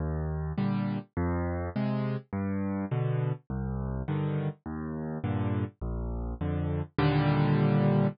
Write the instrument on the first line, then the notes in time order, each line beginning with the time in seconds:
acoustic grand piano
0.00 D#2
0.58 A#2 D3 G3
1.17 F2
1.76 C3 G#3
2.33 G2
2.91 B2 D3
3.50 C2
4.08 G2 D3 D#3
4.66 D#2
5.24 G2 A#2 D3
5.81 A#1
6.41 F2 D3
6.99 D#2 A#2 D3 G3